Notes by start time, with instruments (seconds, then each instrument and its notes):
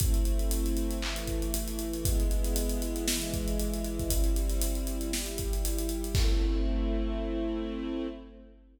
0.00 string ensemble 1 A3 C4 E4, kick, closed hi-hat
0.14 closed hi-hat
0.25 closed hi-hat
0.39 closed hi-hat
0.51 closed hi-hat
0.66 closed hi-hat
0.77 closed hi-hat
0.91 closed hi-hat
1.02 string ensemble 1 E3 A3 E4, clap
1.16 closed hi-hat
1.27 kick, closed hi-hat
1.42 closed hi-hat
1.54 closed hi-hat
1.68 snare, closed hi-hat
1.79 closed hi-hat
1.93 closed hi-hat
2.04 string ensemble 1 G#3 B3 E4, kick, closed hi-hat
2.20 closed hi-hat
2.31 closed hi-hat
2.44 closed hi-hat
2.56 closed hi-hat
2.69 closed hi-hat
2.82 closed hi-hat
2.96 closed hi-hat
3.08 string ensemble 1 E3 G#3 E4, snare
3.21 closed hi-hat
3.33 kick, closed hi-hat
3.48 closed hi-hat
3.60 closed hi-hat
3.74 closed hi-hat
3.85 closed hi-hat
3.99 kick, closed hi-hat
4.10 string ensemble 1 G3 C4 E4, kick, closed hi-hat
4.24 closed hi-hat
4.36 closed hi-hat
4.49 snare, closed hi-hat
4.62 closed hi-hat
4.75 closed hi-hat
4.87 closed hi-hat
5.01 closed hi-hat
5.12 string ensemble 1 G3 E4 G4, snare
5.26 closed hi-hat
5.38 kick, closed hi-hat
5.53 closed hi-hat
5.65 closed hi-hat
5.79 closed hi-hat
5.89 closed hi-hat
6.04 closed hi-hat
6.15 string ensemble 1 A3 C4 E4, kick, crash